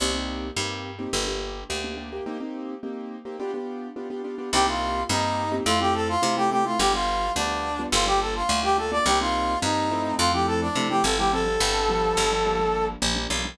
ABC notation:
X:1
M:4/4
L:1/16
Q:1/4=106
K:Cdor
V:1 name="Brass Section"
z16 | z16 | G F3 E4 F G A F2 G G F | G F3 D4 F G A F2 G A d |
G F3 E4 F G A D2 G A G | A12 z4 |]
V:2 name="Acoustic Grand Piano"
[B,CEG] [B,CEG]3 [B,CEG]3 [B,CEG] [B,DG] [B,DG]3 [B,DG] [B,DG] [B,DG] [B,DG] | [B,CEG] [B,CEG]3 [B,CEG]3 [B,CEG] [=B,DFG] [B,DFG]3 [B,DFG] [B,DFG] [B,DFG] [B,DFG] | [B,CEG] [B,CEG]3 [B,CEG]3 [B,CEG] [A,C=EF] [A,CEF]3 [A,CEF] [A,CEF] [A,CEF] [A,CEF] | [G,=B,DF] [G,B,DF]3 [G,B,DF]3 [G,B,DF] [G,_B,DF] [G,B,DF]3 [G,B,DF] [G,B,DF] [G,B,DF] [G,B,DF] |
[G,B,CE] [G,B,CE]3 [G,B,CE]2 [F,A,C=E]3 [F,A,CE]3 [F,A,CE] [F,A,CE] [F,A,CE] [F,A,CE] | [F,G,CD] [F,G,CD]3 [F,G,=B,D]3 [F,G,B,D] [F,G,_B,D] [F,G,B,D]3 [F,G,B,D] [F,G,B,D] [F,G,B,D] [F,G,B,D] |]
V:3 name="Electric Bass (finger)" clef=bass
C,,4 G,,4 G,,,4 D,,4 | z16 | C,,4 G,,4 F,,4 C,4 | G,,,4 D,,4 G,,,4 D,,4 |
C,,4 G,,4 F,,4 C,2 G,,,2- | G,,,2 G,,,4 G,,,6 B,,,2 =B,,,2 |]